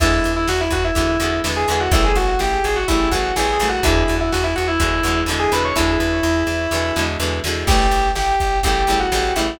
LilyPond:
<<
  \new Staff \with { instrumentName = "Lead 2 (sawtooth)" } { \time 4/4 \key e \mixolydian \tempo 4 = 125 <e' e''>8. <e' e''>16 <fis' fis''>16 <e' e''>16 <fis' fis''>16 <e' e''>4~ <e' e''>16 r16 <gis' gis''>16 <gis' gis''>16 <fis' fis''>16 | <e' e''>16 <gis' gis''>16 <fis' fis''>16 <fis' fis''>16 <g' g''>8 <gis' gis''>16 <fis' fis''>16 <e' e''>8 <fis' fis''>8 \tuplet 3/2 { <gis' gis''>8 <gis' gis''>8 <fis' fis''>8 } | <e' e''>8. <e' e''>16 <fis' fis''>16 <e' e''>16 <fis' fis''>16 <e' e''>4~ <e' e''>16 r16 <gis' gis''>16 <b' b''>16 <cis'' cis'''>16 | <e' e''>2. r4 |
<g' g''>4 <g' g''>4 <g' g''>8. <fis' fis''>8. <e' e''>8 | }
  \new Staff \with { instrumentName = "Acoustic Guitar (steel)" } { \time 4/4 \key e \mixolydian <d e gis b>2 <d e gis b>8 <d e gis b>8 <d e gis b>8 <d e gis b>8 | <cis e g a>2 <cis e g a>8 <cis e g a>8 <cis e g a>8 <cis e g a>8 | <b, d e gis>2 <b, d e gis>8 <b, d e gis>8 <b, d e gis>8 <b, d e gis>8 | <b, d e gis>2 <b, d e gis>8 <b, d e gis>8 <b, d e gis>8 <b, d e gis>8 |
<cis e g a>2 <cis e g a>8 <cis e g a>8 <cis e g a>8 <cis e g a>8 | }
  \new Staff \with { instrumentName = "Electric Bass (finger)" } { \clef bass \time 4/4 \key e \mixolydian e,8 e,8 e,8 e,8 e,8 e,8 e,8 e,8 | a,,8 a,,8 a,,8 a,,8 a,,8 a,,8 a,,8 a,,8 | e,8 e,8 e,8 e,8 e,8 e,8 e,8 e,8 | e,8 e,8 e,8 e,8 e,8 e,8 e,8 e,8 |
a,,8 a,,8 a,,8 a,,8 a,,8 a,,8 a,,8 a,,8 | }
  \new DrumStaff \with { instrumentName = "Drums" } \drummode { \time 4/4 <cymc bd>8 hh8 sn8 <hh bd>8 <hh bd>8 hh8 sn8 hh8 | <hh bd>8 hh8 sn8 hh8 <hh bd>8 <hh bd>8 sn8 hh8 | <hh bd>8 hh8 sn8 hh8 <hh bd>8 hh8 sn8 hh8 | <bd sn>4 sn8 sn8 sn8 sn8 sn8 sn8 |
<cymc bd>8 hh8 sn8 <hh bd>8 <hh bd>8 hh8 sn8 hh8 | }
>>